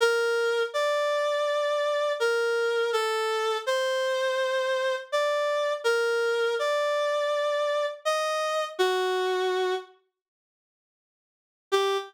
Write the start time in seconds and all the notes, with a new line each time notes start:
0.00 A#4
0.74 D5
2.20 A#4
2.93 A4
3.66 C5
5.12 D5
5.84 A#4
6.59 D5
8.05 D#5
8.79 F#4
11.72 G4